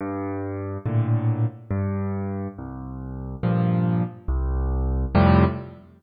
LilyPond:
\new Staff { \clef bass \time 3/4 \key f \major \tempo 4 = 70 g,4 <a, bes, d>4 g,4 | c,4 <g, bes, f>4 c,4 | <f, a, c g>4 r2 | }